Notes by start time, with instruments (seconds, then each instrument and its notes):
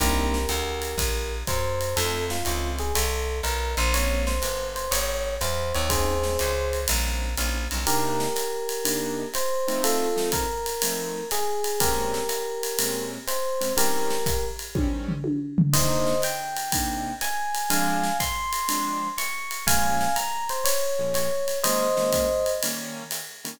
0.00 electric bass (finger) C2, acoustic grand piano A#3 C4 D4 D#4, electric piano 1 G4 A#4, kick, ride
0.34 snare
0.49 electric bass (finger) D2, hi-hat pedal, ride
0.82 ride
0.98 electric bass (finger) A#1, kick, ride
1.47 electric bass (finger) F#2, electric piano 1 C5, kick, hi-hat pedal, ride
1.81 ride
1.96 electric bass (finger) F2, acoustic grand piano A3 C4 D#4 F4, electric piano 1 A4, ride
2.30 electric piano 1 F4, snare
2.45 electric bass (finger) C#2, acoustic grand piano A3 C4 D#4 F4, hi-hat pedal, ride
2.78 electric piano 1 G#4, ride
2.95 electric bass (finger) C2, electric piano 1 A4, ride
3.43 electric bass (finger) B1, electric piano 1 A#4, ride
3.77 electric bass (finger) A#1, electric piano 1 C5, ride
3.93 acoustic grand piano G#3 A#3 C4 C#4, electric piano 1 C#5, ride
4.27 electric piano 1 C5, snare
4.42 electric bass (finger) G1, hi-hat pedal, ride
4.76 electric piano 1 C5, ride
4.91 electric bass (finger) G#1, electric piano 1 C#5, ride
5.41 electric bass (finger) E2, electric piano 1 C5, hi-hat pedal, ride
5.74 electric bass (finger) D#2, electric piano 1 C#5, ride
5.90 acoustic grand piano G3 C4 C#4 D#4, electric piano 1 G#4 C5, kick, ride
6.23 acoustic grand piano G3 C4 C#4 D#4, snare
6.39 electric bass (finger) C#2, hi-hat pedal, ride
6.73 ride
6.88 electric bass (finger) A#1, acoustic grand piano G3 C4 C#4 D#4, ride
7.37 electric bass (finger) A#1, acoustic grand piano G3 C4 C#4 D#4, hi-hat pedal, ride
7.71 electric bass (finger) B1, acoustic grand piano G3 C4 C#4 D#4, ride
7.87 acoustic grand piano C3 A#3 D4 D#4, electric piano 1 G4 A#4, ride
8.20 snare
8.36 hi-hat pedal, ride
8.69 ride
8.85 acoustic grand piano C3 A#3 D4 D#4, ride
9.34 electric piano 1 C5, hi-hat pedal, ride
9.68 acoustic grand piano F3 A3 C4 D#4, ride
9.84 electric piano 1 F4 A4, ride
10.16 acoustic grand piano F3 A3 C4 D#4, snare
10.32 electric piano 1 A#4, kick, hi-hat pedal, ride
10.66 ride
10.82 acoustic grand piano F3 A3 C4 D#4, ride
11.31 electric piano 1 G#4, hi-hat pedal, ride
11.64 ride
11.80 acoustic grand piano A#2 G#3 C4 C#4, electric piano 1 G4 A#4, kick, ride
12.14 snare
12.29 hi-hat pedal, ride
12.63 ride
12.78 acoustic grand piano A#2 G#3 C4 C#4, ride
13.27 electric piano 1 C5, hi-hat pedal, ride
13.61 acoustic grand piano A#2 G#3 C4 C#4, ride
13.76 acoustic grand piano D#3 G3 C4 C#4, electric piano 1 G4 A#4, ride
14.10 snare
14.26 kick, hi-hat pedal, ride
14.59 ride
14.75 acoustic grand piano D#3 G3 C4 C#4, kick, high tom
15.08 floor tom
15.24 high tom
15.58 floor tom
15.73 acoustic grand piano C3 A#3 D4 D#4, electric piano 1 C5 D#5, kick, crash, ride
16.06 snare
16.22 electric piano 1 G5, hi-hat pedal, ride
16.56 ride
16.72 acoustic grand piano C3 A#3 D4 D#4, kick, ride
17.21 electric piano 1 G#5, hi-hat pedal, ride
17.55 ride
17.70 acoustic grand piano F3 G#3 C4 D4, electric piano 1 F5 G#5, ride
18.03 snare
18.20 electric piano 1 C6, kick, hi-hat pedal, ride
18.53 ride
18.68 acoustic grand piano F3 G#3 C4 D4, ride
19.18 electric piano 1 C#6, hi-hat pedal, ride
19.51 ride
19.67 acoustic grand piano A#2 F3 G#3 C#4, electric piano 1 F5 G#5, kick, ride
20.01 snare
20.16 electric piano 1 A#5, hi-hat pedal, ride
20.49 electric piano 1 C5, ride
20.64 electric piano 1 C#5, ride
20.99 acoustic grand piano A#2 F3 G#3 C#4
21.14 electric piano 1 C#5, hi-hat pedal, ride
21.48 ride
21.64 acoustic grand piano D#3 G#3 A#3 C#4, electric piano 1 C5 D#5, ride
21.97 acoustic grand piano D#3 G#3 A#3 C#4, snare
22.12 kick, hi-hat pedal, ride
22.46 ride
22.63 acoustic grand piano D#3 G3 A#3 C#4, ride
23.11 hi-hat pedal, ride
23.44 acoustic grand piano D#3 G3 A#3 C#4, ride